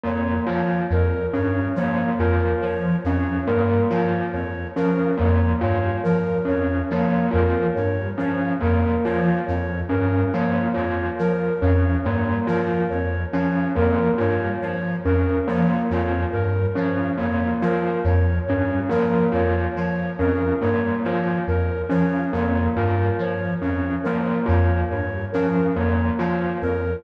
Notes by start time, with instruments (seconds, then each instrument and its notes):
0.04 lead 1 (square) F2, tubular bells A#3, flute C#5
0.46 lead 1 (square) F3, tubular bells F4, flute C#5
0.90 lead 1 (square) F2, flute A#4
1.33 lead 1 (square) G2, tubular bells C#4, flute C#5
1.76 lead 1 (square) F3, tubular bells A#3, flute C#5
2.18 lead 1 (square) F2, tubular bells F4, flute A#4
2.62 lead 1 (square) F3, flute C#5
3.04 lead 1 (square) F2, tubular bells C#4, flute C#5
3.47 lead 1 (square) G2, tubular bells A#3, flute A#4
3.90 lead 1 (square) F3, tubular bells F4, flute C#5
4.33 lead 1 (square) F2, flute C#5
4.76 lead 1 (square) F3, tubular bells C#4, flute A#4
5.17 lead 1 (square) F2, tubular bells A#3, flute C#5
5.61 lead 1 (square) G2, tubular bells F4, flute C#5
6.03 lead 1 (square) F3, flute A#4
6.45 lead 1 (square) F2, tubular bells C#4, flute C#5
6.90 lead 1 (square) F3, tubular bells A#3, flute C#5
7.31 lead 1 (square) F2, tubular bells F4, flute A#4
7.75 lead 1 (square) G2, flute C#5
8.18 lead 1 (square) F3, tubular bells C#4, flute C#5
8.61 lead 1 (square) F2, tubular bells A#3, flute A#4
9.04 lead 1 (square) F3, tubular bells F4, flute C#5
9.46 lead 1 (square) F2, flute C#5
9.89 lead 1 (square) G2, tubular bells C#4, flute A#4
10.33 lead 1 (square) F3, tubular bells A#3, flute C#5
10.74 lead 1 (square) F2, tubular bells F4, flute C#5
11.19 lead 1 (square) F3, flute A#4
11.61 lead 1 (square) F2, tubular bells C#4, flute C#5
12.04 lead 1 (square) G2, tubular bells A#3, flute C#5
12.47 lead 1 (square) F3, tubular bells F4, flute A#4
12.90 lead 1 (square) F2, flute C#5
13.33 lead 1 (square) F3, tubular bells C#4, flute C#5
13.76 lead 1 (square) F2, tubular bells A#3, flute A#4
14.18 lead 1 (square) G2, tubular bells F4, flute C#5
14.61 lead 1 (square) F3, flute C#5
15.05 lead 1 (square) F2, tubular bells C#4, flute A#4
15.46 lead 1 (square) F3, tubular bells A#3, flute C#5
15.90 lead 1 (square) F2, tubular bells F4, flute C#5
16.32 lead 1 (square) G2, flute A#4
16.75 lead 1 (square) F3, tubular bells C#4, flute C#5
17.18 lead 1 (square) F2, tubular bells A#3, flute C#5
17.62 lead 1 (square) F3, tubular bells F4, flute A#4
18.04 lead 1 (square) F2, flute C#5
18.46 lead 1 (square) G2, flute C#5
18.50 tubular bells C#4
18.89 lead 1 (square) F3, tubular bells A#3, flute A#4
19.32 lead 1 (square) F2, tubular bells F4, flute C#5
19.76 lead 1 (square) F3, flute C#5
20.19 lead 1 (square) F2, tubular bells C#4, flute A#4
20.61 lead 1 (square) G2, tubular bells A#3, flute C#5
21.03 lead 1 (square) F3, tubular bells F4, flute C#5
21.47 lead 1 (square) F2, flute A#4
21.89 lead 1 (square) F3, tubular bells C#4, flute C#5
22.33 lead 1 (square) F2, tubular bells A#3, flute C#5
22.75 lead 1 (square) G2, tubular bells F4, flute A#4
23.19 lead 1 (square) F3, flute C#5
23.61 lead 1 (square) F2, tubular bells C#4, flute C#5
24.04 lead 1 (square) F3, tubular bells A#3, flute A#4
24.46 lead 1 (square) F2, tubular bells F4, flute C#5
24.91 lead 1 (square) G2, flute C#5
25.32 lead 1 (square) F3, tubular bells C#4, flute A#4
25.75 lead 1 (square) F2, tubular bells A#3, flute C#5
26.18 lead 1 (square) F3, tubular bells F4, flute C#5
26.62 lead 1 (square) F2, flute A#4